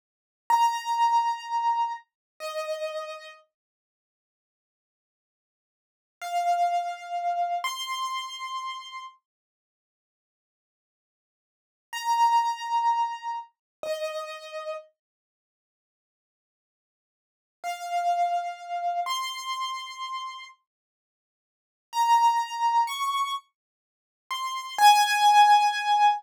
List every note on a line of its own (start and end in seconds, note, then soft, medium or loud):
0.50 1.92 A#5 medium
2.40 3.31 D#5 medium
6.21 7.58 F5 medium
7.64 9.02 C6 medium
11.93 13.35 A#5 medium
13.83 14.73 D#5 medium
17.64 19.00 F5 medium
19.06 20.45 C6 medium
21.93 22.83 A#5 medium
22.87 23.33 C#6 medium
24.31 24.75 C6 medium
24.78 26.10 G#5 loud